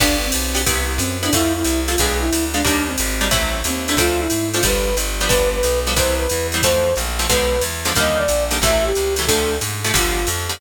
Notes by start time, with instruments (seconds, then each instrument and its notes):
0.00 electric bass (finger) G1, acoustic guitar (steel) B3 D4 F4 G4, flute D4, kick, crash, ride
0.25 flute C4
0.32 electric bass (finger) B1, hi-hat pedal, ride
0.54 acoustic guitar (steel) B3 D4 F4 G4, ride
0.66 electric bass (finger) C2, acoustic guitar (steel) B3 C4 E4 G4, kick, ride
0.98 electric bass (finger) F#2, flute C4, hi-hat pedal, ride
1.23 acoustic guitar (steel) B3 C4 E4 G4, flute D4, ride
1.33 electric bass (finger) F2, acoustic guitar (steel) A3 C4 E4 F4, flute E4, kick, ride
1.53 flute E4
1.64 electric bass (finger) C2, hi-hat pedal, ride
1.88 acoustic guitar (steel) A3 C4 E4 F4, flute F4, ride
1.98 electric bass (finger) B1, acoustic guitar (steel) G#3 B3 D4 F4, flute G#4, kick, ride
2.20 flute E4
2.33 electric bass (finger) D2, hi-hat pedal, ride
2.54 acoustic guitar (steel) G#3 B3 D4 F4, flute D4, ride
2.64 electric bass (finger) D#2, acoustic guitar (steel) G3 A#3 D4 D#4, flute D4, kick, ride
2.87 flute C4
2.98 electric bass (finger) G#1, hi-hat pedal, ride
3.21 acoustic guitar (steel) G3 A#3 D4 D#4, ride
3.31 electric bass (finger) A1, acoustic guitar (steel) F#3 A3 C4 E4, kick, ride
3.64 electric bass (finger) D#2, flute C4, hi-hat pedal, ride
3.88 acoustic guitar (steel) F#3 A3 C4 E4, flute D4, ride
3.97 electric bass (finger) D2, acoustic guitar (steel) F3 A3 C4 D4, flute F4, kick, ride
4.20 flute E4
4.30 electric bass (finger) G#2, hi-hat pedal, ride
4.54 acoustic guitar (steel) F3 A3 C4 D4, flute F4, ride
4.63 electric bass (finger) G1, acoustic guitar (steel) F3 G3 B3 D4, flute B4, kick, ride
4.97 electric bass (finger) G1, hi-hat pedal, ride
5.20 acoustic guitar (steel) F3 G3 B3 D4, ride
5.28 electric bass (finger) G1, acoustic guitar (steel) F3 G3 B3 D4, flute B4, kick, ride
5.53 flute B4
5.63 electric bass (finger) B1, hi-hat pedal, ride
5.87 acoustic guitar (steel) F3 G3 B3 D4, ride
5.96 electric bass (finger) C2, acoustic guitar (steel) E3 G3 B3 C4, flute C5, kick, ride
6.18 flute B4
6.29 electric bass (finger) E2, hi-hat pedal, ride
6.52 acoustic guitar (steel) E3 G3 B3 C4, ride
6.62 electric bass (finger) F2, acoustic guitar (steel) E3 F3 A3 C4, flute C5, kick, ride
6.96 electric bass (finger) A#1, hi-hat pedal, ride
7.19 acoustic guitar (steel) E3 F3 A3 C4, ride
7.29 electric bass (finger) B1, acoustic guitar (steel) D3 F3 G#3 B3, flute B4, kick, ride
7.61 electric bass (finger) E2, hi-hat pedal, ride
7.85 acoustic guitar (steel) D3 F3 G#3 B3, ride
7.95 electric bass (finger) D#2, acoustic guitar (steel) D3 D#3 G3 A#3, flute D#5, kick, ride
8.17 flute D5
8.28 electric bass (finger) A#1, hi-hat pedal, ride
8.51 acoustic guitar (steel) D3 D#3 G3 A#3, ride
8.62 electric bass (finger) A1, acoustic guitar (steel) C3 E3 F#3 A3, flute E5, kick, ride
8.84 flute G4
8.95 electric bass (finger) C#2, hi-hat pedal, ride
9.16 acoustic guitar (steel) C3 E3 F#3 A3, ride
9.27 electric bass (finger) D2, acoustic guitar (steel) C3 D3 F3 A3, flute A4, kick, ride
9.61 electric bass (finger) G#2, hi-hat pedal, ride
9.84 acoustic guitar (steel) C3 D3 F3 A3, ride
9.94 electric bass (finger) G1, acoustic guitar (steel) D3 F3 G3 B3, flute F4, kick, ride
10.27 electric bass (finger) F2, hi-hat pedal, ride
10.49 acoustic guitar (steel) D3 F3 G3 B3, ride